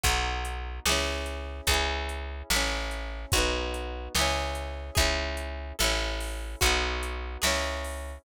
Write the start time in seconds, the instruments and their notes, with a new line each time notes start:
0.04 electric bass (finger) B1, acoustic guitar (steel) D#4 F#4, kick, closed hi-hat
0.09 acoustic guitar (steel) B3
0.45 closed hi-hat
0.86 electric bass (finger) C#2, acoustic guitar (steel) E4 G#4, snare
0.92 acoustic guitar (steel) C#4
1.26 closed hi-hat
1.67 electric bass (finger) C#2, acoustic guitar (steel) G#4, kick, closed hi-hat
1.71 acoustic guitar (steel) C#4 E4
2.09 closed hi-hat
2.50 electric bass (finger) A1, acoustic guitar (steel) E4 A4, snare
2.56 acoustic guitar (steel) C#4
2.91 closed hi-hat
3.32 electric bass (finger) B1, acoustic guitar (steel) D#4 F#4, kick, closed hi-hat
3.38 acoustic guitar (steel) B3
3.74 closed hi-hat
4.15 electric bass (finger) C#2, acoustic guitar (steel) G#4, snare
4.19 acoustic guitar (steel) C#4 E4
4.55 closed hi-hat
4.95 electric bass (finger) C#2, acoustic guitar (steel) E4 G#4, kick, closed hi-hat
5.00 acoustic guitar (steel) C#4
5.37 closed hi-hat
5.79 electric bass (finger) A1, acoustic guitar (steel) E4 A4, snare
5.84 acoustic guitar (steel) C#4
6.20 open hi-hat
6.61 electric bass (finger) B1, acoustic guitar (steel) D#4 F#4, kick, closed hi-hat
6.66 acoustic guitar (steel) B3
7.03 closed hi-hat
7.42 electric bass (finger) C#2, acoustic guitar (steel) E4 G#4, snare
7.47 acoustic guitar (steel) C#4
7.84 open hi-hat